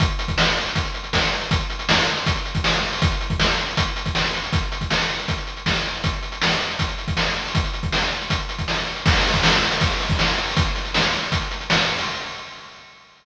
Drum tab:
CC |----------------|----------------|----------------|----------------|
HH |xxxx-xxxxxxx-xxx|xxxx-xxxxxxx-xxo|xxxx-xxxxxxx-xxx|xxxx-xxxxxxx-xxx|
SD |----o-------o---|----o-------o---|----o-------o---|----o-------o---|
BD |o--o----o---o---|o-------o--o----|o--o----o--o----|o--o----o---o---|

CC |----------------|----------------|x---------------|----------------|
HH |xxxx-xxxxxxx-xxo|xxxx-xxxxxxx-xxx|-xxx-xxxxxxx-xxo|xxxx-xxxxxxx-xxo|
SD |----o-------o---|----o-------o---|----o-------o---|----o-------o---|
BD |o-------o--o----|o--o----o--o----|o--o----o--o----|o-------o-------|